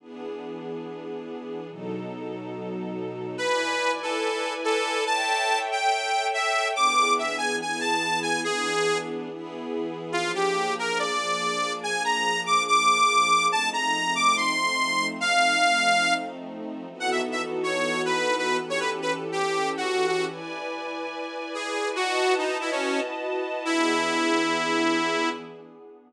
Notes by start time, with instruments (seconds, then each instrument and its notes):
0.00 string ensemble 1 E3 B3 D4 G#4
1.69 string ensemble 1 B2 F#3 D#4 A4
3.38 string ensemble 1 E4 B4 D5 G#5, lead 2 (sawtooth) B4
4.03 lead 2 (sawtooth) A4
4.64 lead 2 (sawtooth) A4
5.06 string ensemble 1 A4 C#5 E5 G5, lead 2 (sawtooth) A5
5.72 lead 2 (sawtooth) G5
6.34 lead 2 (sawtooth) E5
6.76 string ensemble 1 E3 B3 D4 G#4, lead 2 (sawtooth) D6
7.19 lead 2 (sawtooth) E5
7.38 lead 2 (sawtooth) G#5
7.60 string ensemble 1 E3 B3 E4 G#4, lead 2 (sawtooth) G#5
7.80 lead 2 (sawtooth) A5
8.22 lead 2 (sawtooth) G#5
8.44 string ensemble 1 E3 B3 D4 G#4, lead 2 (sawtooth) G#4
9.30 string ensemble 1 E3 B3 E4 G#4
10.12 string ensemble 1 F3 A#3 D4 G#4, lead 2 (sawtooth) F4
10.35 lead 2 (sawtooth) G4
10.79 lead 2 (sawtooth) A#4
10.99 lead 2 (sawtooth) D5
11.83 lead 2 (sawtooth) G#5
12.04 lead 2 (sawtooth) A#5
12.46 lead 2 (sawtooth) D6
12.68 lead 2 (sawtooth) D6
13.52 string ensemble 1 F3 A3 C4 D#4, lead 2 (sawtooth) A5
13.73 lead 2 (sawtooth) A#5
14.15 lead 2 (sawtooth) D6
14.37 lead 2 (sawtooth) C6
15.21 lead 2 (sawtooth) F5
16.90 string ensemble 1 E3 B3 D#4 F#4 A4
17.00 lead 2 (sawtooth) F#5
17.11 lead 2 (sawtooth) E5
17.32 lead 2 (sawtooth) E5
17.63 lead 2 (sawtooth) C#5
18.05 lead 2 (sawtooth) B4
18.38 lead 2 (sawtooth) B4
18.59 string ensemble 1 E3 C#4 G4 A4
18.70 lead 2 (sawtooth) C#5
18.80 lead 2 (sawtooth) B4
19.02 lead 2 (sawtooth) B4
19.32 lead 2 (sawtooth) G4
19.77 lead 2 (sawtooth) F#4
20.07 lead 2 (sawtooth) F#4
20.28 string ensemble 1 E4 B4 D5 G#5
21.54 lead 2 (sawtooth) G#4
21.96 string ensemble 1 E4 F#4 B4 D#5 A5, lead 2 (sawtooth) F#4
22.38 lead 2 (sawtooth) D#4
22.61 lead 2 (sawtooth) E4
22.71 lead 2 (sawtooth) C#4
23.65 string ensemble 1 E3 B3 D4 G#4, lead 2 (sawtooth) E4